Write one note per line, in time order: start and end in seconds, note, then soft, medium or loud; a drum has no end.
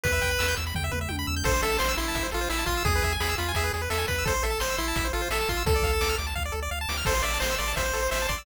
0.04 0.20 E2 loud
0.04 0.55 B4 medium
0.04 0.12 B4 loud
0.04 kick loud
0.04 closed hi-hat loud
0.12 0.20 E5 medium
0.21 0.37 E2 medium
0.21 0.29 G5 loud
0.21 kick medium
0.21 closed hi-hat medium
0.31 0.39 B5 medium
0.39 0.55 E2 medium
0.39 0.47 E6 medium
0.39 snare loud
0.48 0.56 G6 medium
0.56 0.73 E2 medium
0.56 0.65 E6 medium
0.56 closed hi-hat medium
0.67 0.74 B5 medium
0.74 0.90 E2 medium
0.74 0.84 G5 loud
0.74 kick medium
0.74 floor tom medium
0.84 0.92 E5 medium
0.92 1.08 E2 medium
0.92 0.99 B4 loud
0.92 mid tom medium
1.01 1.09 E5 medium
1.09 1.25 E2 medium
1.09 1.17 G5 medium
1.09 high tom medium
1.19 1.27 B5 medium
1.27 1.43 E2 medium
1.27 1.35 E6 medium
1.36 1.44 G6 medium
1.44 1.60 A1 loud
1.44 1.52 A4 loud
1.44 1.61 C5 loud
1.44 kick loud
1.44 crash loud
1.54 1.62 C5 medium
1.63 1.78 A1 medium
1.63 1.77 A4 loud
1.63 1.71 E5 medium
1.63 closed hi-hat medium
1.72 1.80 A5 medium
1.78 1.95 A1 medium
1.78 1.93 C5 medium
1.78 1.88 C6 loud
1.78 snare loud
1.89 1.97 E6 loud
1.97 2.12 A1 medium
1.97 2.27 E4 medium
1.97 2.06 C6 medium
1.97 closed hi-hat medium
2.08 2.16 A5 medium
2.15 2.30 A1 medium
2.15 2.23 E5 loud
2.15 kick medium
2.15 closed hi-hat loud
2.23 2.31 C5 medium
2.31 2.48 A1 medium
2.31 2.49 F4 medium
2.31 2.40 A4 medium
2.31 closed hi-hat medium
2.41 2.49 C5 medium
2.49 2.65 A1 medium
2.49 2.65 E4 medium
2.49 2.58 E5 loud
2.49 snare loud
2.58 2.66 A5 medium
2.66 2.82 A1 medium
2.66 2.83 F4 medium
2.66 2.75 C6 medium
2.66 kick medium
2.66 closed hi-hat medium
2.77 2.85 E6 medium
2.85 3.00 E2 loud
2.85 3.13 G#4 medium
2.85 2.93 G#4 loud
2.85 kick loud
2.85 closed hi-hat loud
2.95 3.03 B4 medium
3.02 3.17 E2 medium
3.02 3.12 E5 medium
3.02 kick medium
3.02 closed hi-hat medium
3.12 3.20 G#5 medium
3.20 3.35 E2 medium
3.20 3.35 G#4 medium
3.20 3.28 B5 medium
3.20 snare loud
3.29 3.37 E6 medium
3.38 3.53 E2 medium
3.38 3.52 F4 medium
3.38 3.46 B5 medium
3.38 closed hi-hat medium
3.48 3.56 G#5 medium
3.54 3.71 E2 medium
3.54 3.73 G#4 medium
3.54 3.64 E5 loud
3.54 kick medium
3.54 closed hi-hat loud
3.64 3.72 B4 medium
3.73 3.88 E2 medium
3.73 3.82 G#4 medium
3.73 closed hi-hat medium
3.82 3.90 B4 medium
3.90 4.05 E2 medium
3.90 4.06 A4 medium
3.90 3.98 E5 loud
3.90 snare loud
3.98 4.06 G#5 medium
4.07 4.24 E2 medium
4.07 4.25 B4 medium
4.07 4.16 B5 medium
4.07 kick loud
4.07 closed hi-hat medium
4.18 4.26 E6 medium
4.25 4.40 A1 medium
4.25 4.33 A4 loud
4.25 4.43 C5 medium
4.25 kick loud
4.25 closed hi-hat loud
4.34 4.42 C5 medium
4.43 4.58 A1 medium
4.43 4.60 A4 medium
4.43 4.51 E5 medium
4.43 closed hi-hat medium
4.50 4.58 A5 medium
4.60 4.76 A1 medium
4.60 4.76 C5 medium
4.60 4.68 C6 medium
4.60 snare loud
4.70 4.78 E6 medium
4.77 4.93 A1 medium
4.77 5.08 E4 medium
4.77 4.86 C6 medium
4.77 closed hi-hat medium
4.88 4.96 A5 medium
4.96 5.11 A1 medium
4.96 5.04 E5 loud
4.96 kick loud
4.96 closed hi-hat loud
5.05 5.12 C5 medium
5.13 5.29 A1 medium
5.13 5.28 F4 medium
5.13 5.21 A4 medium
5.13 closed hi-hat medium
5.22 5.30 C5 medium
5.30 5.45 A1 medium
5.30 5.49 A4 medium
5.30 5.39 E5 loud
5.30 snare loud
5.41 5.49 A5 medium
5.49 5.64 A1 medium
5.49 5.63 F4 medium
5.49 5.57 C6 medium
5.49 kick medium
5.49 closed hi-hat medium
5.57 5.65 E6 medium
5.66 5.81 D2 medium
5.66 5.74 A4 loud
5.66 6.16 A4 medium
5.66 kick loud
5.66 closed hi-hat loud
5.76 5.83 D5 medium
5.82 5.99 D2 medium
5.82 5.91 F5 medium
5.82 kick medium
5.82 closed hi-hat medium
5.93 6.01 A5 medium
6.01 6.16 D2 medium
6.01 6.09 D6 loud
6.01 snare loud
6.09 6.17 F6 medium
6.18 6.34 D2 medium
6.18 6.26 D6 medium
6.18 closed hi-hat medium
6.27 6.35 A5 medium
6.35 6.51 D2 medium
6.35 6.43 F5 loud
6.35 kick medium
6.45 6.53 D5 medium
6.52 6.69 D2 medium
6.52 6.60 A4 medium
6.62 6.70 D5 loud
6.71 6.86 D2 medium
6.71 6.79 F5 loud
6.81 6.89 A5 loud
6.89 7.03 D2 medium
6.89 6.97 D6 medium
6.89 snare loud
6.97 7.05 F6 medium
7.05 7.22 A1 loud
7.05 7.13 A4 loud
7.05 7.22 C5 medium
7.05 kick loud
7.05 crash loud
7.15 7.23 C5 medium
7.23 7.39 A1 medium
7.23 7.38 D5 medium
7.23 7.32 E5 medium
7.23 closed hi-hat medium
7.34 7.42 A5 medium
7.40 7.57 A1 medium
7.40 7.55 C5 medium
7.40 7.50 C6 medium
7.40 snare loud
7.51 7.58 E6 medium
7.58 7.74 A1 medium
7.58 7.73 D5 medium
7.58 7.67 C6 medium
7.58 closed hi-hat medium
7.68 7.76 A5 medium
7.76 7.92 A1 medium
7.76 8.08 C5 medium
7.76 7.84 E5 medium
7.76 kick medium
7.76 closed hi-hat loud
7.86 7.94 C5 medium
7.93 8.09 A1 medium
7.93 8.01 A4 medium
7.93 closed hi-hat medium
8.02 8.10 C5 medium
8.11 8.27 A1 medium
8.11 8.27 C5 medium
8.11 8.19 E5 loud
8.11 snare loud
8.22 8.30 A5 medium
8.29 8.44 A1 medium
8.29 8.43 D5 medium
8.29 8.36 C6 medium
8.29 kick medium
8.29 closed hi-hat medium
8.38 8.45 E6 medium